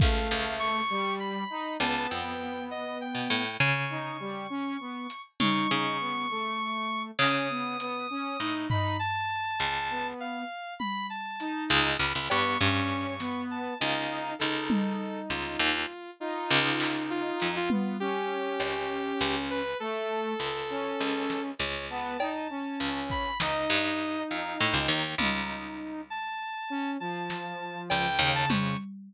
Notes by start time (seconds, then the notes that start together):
0.00 C#2 A3 F5, kick
0.31 C#2
0.59 C#6
0.90 G3
1.20 B5
1.50 D#4
1.80 C#2 B3 A5, cowbell
2.10 F2 G5
2.71 D#5
3.01 G5
3.15 B2
3.30 A2
3.60 C#3 C#6
3.90 D#4
4.20 G3
4.50 C#4
4.80 B3
5.10 closed hi-hat
5.40 C#3 D#4 C#6, high tom
5.70 C#3 D#4
6.00 B3
6.30 A3
7.19 C#3 C#4 D#6, clap
7.50 B3
7.80 B3, closed hi-hat
8.10 C#4
8.40 A2 D#4
8.70 D#4 B5, floor tom
8.99 A5
9.60 C#2
9.90 B3
10.20 F5
10.79 B5, high tom
11.10 A5
11.40 D#4, closed hi-hat
11.70 C#2 D#6
11.99 C#2 B5
12.15 C#2
12.30 G2 B3 C#6, cowbell
12.60 G2 C#4 C#6
13.20 B3, snare
13.51 A5
13.80 C#2 D#4 F5
14.39 C#2 D#4 A4, snare
14.70 high tom
15.29 C#2 F4
15.59 D#2
16.20 D#4 F4
16.50 C#2
16.80 clap
17.10 F4
17.40 F2, closed hi-hat
17.56 F4
17.70 B3 F4, high tom
18.00 C#4 G4
18.60 C#2, cowbell
19.21 C#2
19.50 B4
19.80 A3 A4
20.40 C#2
20.70 C#4
21.00 C#2
21.30 snare
21.59 C#2 C#5
21.90 B3 A5
22.20 D#4, cowbell
22.50 C#4
22.80 C#2
23.10 B5, kick
23.40 C#2 D#4 D#5, snare
23.70 G2, clap
24.30 F2 F5
24.59 A2 G5
24.73 C#2
24.88 D#2
25.18 C#2 D#4, high tom
26.10 A5
26.70 C#4
27.00 F3 A5
27.30 snare
27.90 C#2 G5, cowbell
28.19 D#2 C#3
28.35 A5
28.49 F2 C#6, high tom